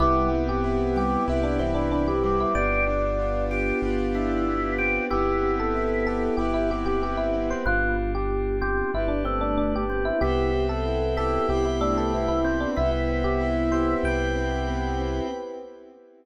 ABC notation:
X:1
M:4/4
L:1/16
Q:1/4=94
K:C
V:1 name="Electric Piano 1"
E3 G3 G2 E D C D D G2 E | d6 z10 | G3 A3 A2 G E G G G E2 c | F3 G3 G2 E D C D D G2 E |
G3 A3 A2 G E D A E E2 D | E E2 G z2 c2 g6 z2 |]
V:2 name="Drawbar Organ"
G,2 z4 G,2 z2 E,4 G,2 | G2 z4 G2 z2 E4 G2 | E6 z10 | B,2 z4 C2 z2 A,4 C2 |
E2 z4 E2 z2 A,4 C2 | E8 z8 |]
V:3 name="Acoustic Grand Piano"
B,2 C2 E2 G2 E2 C2 B,2 C2 | B,2 D2 F2 G2 F2 D2 B,2 C2 | B,2 C2 E2 G2 E2 C2 B,2 C2 | z16 |
B,2 C2 E2 G2 E2 C2 B,2 C2 | B,2 C2 E2 G2 E2 C2 B,2 C2 |]
V:4 name="Synth Bass 2" clef=bass
C,,8 C,,8 | G,,,8 G,,,8 | G,,,8 G,,,8 | G,,,8 G,,,8 |
C,,8 C,,8 | C,,8 C,,8 |]
V:5 name="Pad 5 (bowed)"
[B,CEG]8 [B,CGB]8 | [B,DFG]8 [B,DGB]8 | [B,CEG]8 [B,CGB]8 | [B,DFG]8 [B,DGB]8 |
[Bceg]8 [Bcgb]8 | [Bceg]8 [Bcgb]8 |]